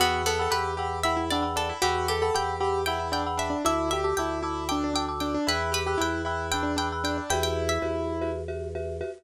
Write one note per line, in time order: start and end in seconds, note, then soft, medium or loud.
0.00 0.48 E2 loud
0.00 0.22 B3 medium
0.00 0.23 F#4 loud
0.00 0.30 F#5 loud
0.00 0.30 G5 loud
0.00 0.30 B5 loud
0.00 0.30 E6 loud
0.26 0.51 B3 medium
0.26 0.39 A4 loud
0.39 0.54 A4 loud
0.39 0.50 F#5 loud
0.39 0.50 G5 loud
0.39 0.50 B5 medium
0.39 0.50 E6 loud
0.51 1.72 E2 medium
0.51 0.73 G4 loud
0.51 0.97 B4 medium
0.51 0.72 F#5 medium
0.51 0.72 G5 medium
0.51 0.72 B5 loud
0.51 0.72 E6 loud
0.77 0.99 G4 medium
0.77 1.00 F#5 loud
0.77 1.00 G5 medium
0.77 1.00 B5 loud
0.77 1.00 E6 medium
1.03 1.16 E4 loud
1.03 1.25 E5 medium
1.03 1.25 F#5 loud
1.03 1.25 G5 loud
1.03 1.25 B5 medium
1.03 1.25 E6 medium
1.17 1.29 E4 medium
1.30 1.44 D4 loud
1.30 1.53 D5 medium
1.30 1.42 F#5 loud
1.30 1.42 G5 medium
1.30 1.42 B5 loud
1.30 1.42 E6 loud
1.42 1.74 F#5 loud
1.42 1.74 G5 medium
1.42 1.74 B5 medium
1.42 1.74 E6 loud
1.56 1.68 D4 loud
1.56 1.78 A4 medium
1.69 1.82 E4 loud
1.82 2.31 E2 loud
1.82 2.07 F#4 loud
1.82 2.07 G4 medium
1.82 2.14 F#5 loud
1.82 2.14 G5 loud
1.82 2.14 B5 loud
1.82 2.14 E6 loud
2.08 2.30 G4 medium
2.08 2.21 A4 medium
2.22 2.34 A4 loud
2.22 2.32 F#5 medium
2.22 2.32 G5 medium
2.22 2.32 B5 loud
2.22 2.32 E6 loud
2.34 3.55 E2 medium
2.34 2.58 G4 loud
2.34 2.55 F#5 loud
2.34 2.55 G5 loud
2.34 2.85 G5 medium
2.34 2.55 B5 loud
2.34 2.55 E6 loud
2.60 2.82 G4 loud
2.60 2.81 F#5 loud
2.60 2.81 G5 medium
2.60 2.81 B5 loud
2.60 2.81 E6 loud
2.86 2.99 E4 loud
2.86 3.08 F#5 medium
2.86 3.11 G5 medium
2.86 3.08 G5 loud
2.86 3.08 B5 medium
2.86 3.08 E6 loud
2.99 3.12 E4 loud
3.12 3.24 D4 loud
3.12 3.23 F#5 loud
3.12 3.23 G5 medium
3.12 3.35 G5 medium
3.12 3.23 B5 loud
3.12 3.23 E6 loud
3.27 3.58 F#5 loud
3.27 3.58 G5 medium
3.27 3.58 B5 loud
3.27 3.58 E6 medium
3.37 3.49 D4 loud
3.37 3.64 E5 medium
3.50 3.62 D4 loud
3.65 4.13 D2 loud
3.65 3.89 E4 loud
3.65 3.90 E5 medium
3.65 3.97 A5 loud
3.65 3.97 D6 loud
3.65 3.97 E6 loud
3.91 4.04 G4 loud
3.91 4.12 E5 medium
4.04 4.17 G4 medium
4.04 4.14 A5 medium
4.04 4.14 D6 medium
4.04 4.14 E6 loud
4.17 5.37 D2 medium
4.17 4.41 E4 loud
4.17 4.65 G5 medium
4.17 4.39 A5 loud
4.17 4.39 D6 medium
4.17 4.39 E6 loud
4.42 4.68 E4 loud
4.42 4.64 A5 loud
4.42 4.64 D6 medium
4.42 4.64 E6 loud
4.69 4.83 D4 loud
4.69 4.90 G5 medium
4.69 4.90 A5 loud
4.69 4.90 D6 loud
4.69 4.90 E6 medium
4.84 4.93 D4 loud
4.94 5.06 D4 medium
4.94 5.19 G5 medium
4.94 5.05 A5 medium
4.94 5.05 D6 loud
4.94 5.05 E6 loud
5.08 5.40 A5 medium
5.08 5.40 D6 loud
5.08 5.40 E6 loud
5.20 5.33 D4 loud
5.20 5.45 G5 medium
5.34 5.47 D4 loud
5.47 5.96 E2 loud
5.47 5.70 E4 loud
5.47 5.70 B4 medium
5.47 5.80 G5 loud
5.47 5.80 B5 loud
5.47 5.80 E6 loud
5.47 5.80 F#6 loud
5.72 5.84 G4 loud
5.72 5.96 B4 medium
5.87 5.99 G4 loud
5.87 5.97 G5 loud
5.87 5.97 B5 medium
5.87 5.97 E6 medium
5.87 5.97 F#6 medium
5.98 7.20 E2 loud
5.98 6.22 E4 loud
5.98 6.21 G5 medium
5.98 6.47 G5 medium
5.98 6.21 B5 medium
5.98 6.21 E6 loud
5.98 6.21 F#6 loud
6.25 6.50 E4 loud
6.25 6.47 G5 loud
6.25 6.47 B5 medium
6.25 6.47 E6 medium
6.25 6.47 F#6 loud
6.51 6.62 D4 medium
6.51 6.72 G5 loud
6.51 6.76 G5 medium
6.51 6.72 B5 loud
6.51 6.72 E6 loud
6.51 6.72 F#6 medium
6.63 6.75 D4 loud
6.76 6.89 D4 loud
6.76 7.02 G5 medium
6.76 6.88 G5 loud
6.76 6.88 B5 loud
6.76 6.88 E6 medium
6.76 6.88 F#6 medium
6.92 7.24 G5 medium
6.92 7.24 B5 loud
6.92 7.24 E6 loud
6.92 7.24 F#6 medium
7.04 7.16 D4 loud
7.04 7.27 G5 medium
7.18 7.30 D4 medium
7.30 7.78 E2 loud
7.30 8.30 E4 loud
7.30 7.74 F#4 loud
7.30 7.74 G4 loud
7.30 7.74 B4 loud
7.30 7.74 E5 loud
7.30 7.43 G5 medium
7.43 7.65 G5 medium
7.69 8.05 E5 medium
7.82 9.03 E2 medium
7.82 8.13 F#4 loud
7.82 8.13 G4 loud
7.82 8.13 B4 medium
7.82 8.13 E5 loud
8.21 8.42 F#4 loud
8.21 8.42 G4 medium
8.21 8.42 B4 loud
8.21 8.42 E5 loud
8.48 8.69 F#4 loud
8.48 8.69 G4 loud
8.48 8.69 B4 loud
8.48 8.69 E5 loud
8.75 8.96 F#4 medium
8.75 8.96 G4 medium
8.75 8.96 B4 loud
8.75 8.96 E5 loud
9.01 9.11 F#4 loud
9.01 9.11 G4 loud
9.01 9.11 B4 loud
9.01 9.11 E5 loud